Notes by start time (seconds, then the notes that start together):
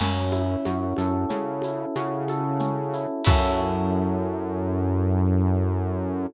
0.00 F#2 C#4, crash, low conga, shaker
0.32 E4, high conga, shaker
0.65 F#2 F#4, high conga, shaker
0.96 F#2 A4, high conga, shaker
1.29 C#3 C#4, low conga, shaker
1.62 E4, high conga, shaker
1.95 C#3 F#4, high conga, shaker
2.28 A4, high conga, shaker
2.60 C#4, low conga, shaker
2.93 E4, shaker
3.24 F#2 C#4 E4 F#4 A4, kick, crash